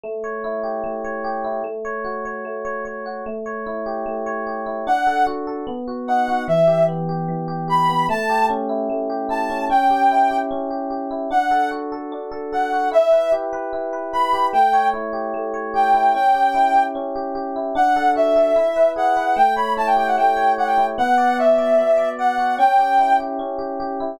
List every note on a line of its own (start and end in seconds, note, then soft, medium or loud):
0.04 0.83 A3 medium
0.24 1.04 C#5 medium
0.44 1.44 E4 medium
0.64 1.24 G4 medium
0.84 1.60 A3 medium
1.04 1.62 C#5 medium
1.24 1.63 G4 medium
1.44 1.64 E4 medium
1.64 2.44 A3 medium
1.85 2.25 C#5 medium
2.05 3.05 F#4 medium
2.25 2.64 C#5 medium
2.45 3.21 A3 medium
2.65 2.85 C#5 medium
2.85 3.23 C#5 medium
3.06 3.25 F#4 medium
3.26 4.05 A3 medium
3.46 4.26 C#5 medium
3.66 4.66 E4 medium
3.86 4.46 G4 medium
4.06 4.82 A3 medium
4.26 4.84 C#5 medium
4.47 4.85 G4 medium
4.66 4.85 E4 medium
4.87 5.63 D4 loud
4.87 5.25 F#5 loud
5.07 5.47 A4 medium
5.27 5.65 F#4 medium
5.47 5.66 A4 medium
5.67 6.43 B3 medium
5.88 6.28 F#4 medium
6.08 6.47 D#4 medium
6.08 6.44 F#5 medium
6.28 6.47 F#4 medium
6.48 7.28 E3 medium
6.48 6.85 E5 loud
6.67 7.08 G4 medium
6.88 7.88 B3 medium
7.09 7.47 G4 medium
7.28 8.05 E3 medium
7.48 7.68 G4 medium
7.68 8.06 G4 medium
7.68 8.06 B5 loud
7.89 8.08 B3 medium
8.09 8.89 A3 loud
8.09 8.46 A5 loud
8.29 9.09 G4 medium
8.50 9.49 C#4 medium
8.69 9.29 E4 medium
8.90 9.66 A3 medium
9.10 9.67 G4 medium
9.29 9.67 E4 medium
9.29 9.65 A5 medium
9.50 9.69 C#4 medium
9.70 10.50 C#4 medium
9.70 10.38 G5 loud
9.90 10.30 G4 medium
10.11 11.10 E4 medium
10.31 10.70 G4 medium
10.51 11.27 C#4 medium
10.71 10.90 G4 medium
10.90 11.29 G4 medium
11.11 11.30 E4 medium
11.31 12.12 D4 medium
11.31 11.70 F#5 loud
11.51 11.92 A4 medium
11.71 12.72 F#4 medium
11.92 12.31 A4 medium
12.12 12.89 D4 medium
12.32 12.52 A4 medium
12.53 12.91 A4 medium
12.53 12.89 F#5 medium
12.72 12.92 F#4 medium
12.92 13.72 E4 medium
12.92 13.32 E5 loud
13.12 13.52 B4 medium
13.32 14.33 G4 medium
13.53 13.92 B4 medium
13.73 14.49 E4 medium
13.93 14.13 B4 medium
14.13 14.52 B4 medium
14.13 14.47 B5 loud
14.33 14.52 G4 medium
14.53 15.33 A3 medium
14.53 14.88 G5 loud
14.73 15.53 C#5 medium
14.94 15.94 E4 medium
15.13 15.73 G4 medium
15.34 16.10 A3 medium
15.54 16.11 C#5 medium
15.74 16.12 G4 medium
15.74 16.13 G5 medium
15.94 16.13 E4 medium
16.14 16.95 C#4 medium
16.14 16.83 G5 loud
16.35 16.75 G4 medium
16.54 17.55 E4 medium
16.76 17.15 G4 medium
16.95 17.72 C#4 medium
17.16 17.35 G4 medium
17.35 17.73 G4 medium
17.56 17.75 E4 medium
17.75 18.52 D4 loud
17.75 18.11 F#5 loud
17.96 18.35 A4 medium
18.16 18.54 F#4 medium
18.16 18.90 E5 loud
18.36 18.55 A4 medium
18.56 19.33 E4 loud
18.76 19.16 B4 medium
18.96 19.34 G#4 medium
18.96 19.36 F#5 loud
19.17 19.36 B4 medium
19.36 20.17 A3 medium
19.36 19.54 G5 loud
19.56 20.36 C#5 medium
19.56 19.73 B5 medium
19.77 20.77 E4 medium
19.77 19.87 A5 loud
19.86 19.96 G5 loud
19.96 20.58 G4 medium
19.96 20.07 G5 loud
20.07 20.17 F#5 medium
20.17 20.94 A3 medium
20.17 20.52 G5 medium
20.37 20.94 C#5 medium
20.58 20.96 G4 medium
20.58 20.67 F#5 medium
20.67 20.85 G5 medium
20.78 20.97 E4 medium
20.98 21.78 B3 loud
20.98 21.37 F#5 loud
21.18 21.58 D5 medium
21.39 22.38 F#4 medium
21.39 22.09 E5 loud
21.58 21.97 D5 medium
21.78 22.55 B3 medium
21.98 22.18 D5 medium
22.19 22.57 D5 medium
22.19 22.56 F#5 loud
22.38 22.57 F#4 medium
22.58 23.39 C#4 loud
22.58 23.16 G5 loud
22.79 23.19 G4 medium
22.99 24.00 E4 medium
23.20 23.58 G4 medium
23.39 24.16 C#4 medium
23.59 23.79 G4 medium
23.80 24.18 G4 medium
24.00 24.19 E4 medium